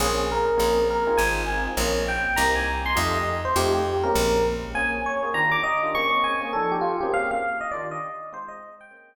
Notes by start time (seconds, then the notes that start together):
0.00 A#1 A#3 C4 C#4 G#4
0.32 A#4
0.57 A#1 A#3 C4 C#4 G#4
0.90 A#4
1.07 C4 D#4 F4 G#4
1.17 G#1 G#5
1.48 C4 D#4 F4 G#4
1.77 A#1 A#3 C4 C#4 G#4
2.08 G5
2.36 C2 A#3 C4 D#4 G4 A#5
2.56 G#5
2.86 C6
2.95 F2 A3 D#4 F4 G4 D#5
3.14 D#5
3.45 C5
3.56 F2 A3 D#4 F4 G4
3.74 G4
4.03 G#3 A#3 C4 C#4 A#4
4.15 A#1
4.74 A#3 C4 C#4 G#4 G#5
5.06 C#5
5.23 A#3 C4 C#4 G#4
5.34 D#3 D4 F4 G4 A#5
5.51 D6
5.63 D#5
5.83 D#3 D4 F4 G4
5.94 A#3 C4 C#4 G#4 C#6
6.12 A#3 C4 C#4 G#4
6.24 G#5
6.41 A#3 C4 C#4 G#4
6.53 F3 D4 D#4 A4
6.72 G4
6.81 F4
7.01 A#3 C4 C#4 G4 G#4
7.14 F5
7.31 F5
7.61 D#5
7.71 D#3 D4 F4 G4 D5
7.91 D#5
8.32 G#3 C4 D#4 F4 C5
8.48 D#5
8.81 G5
8.91 A#3 C4 C#4 G#4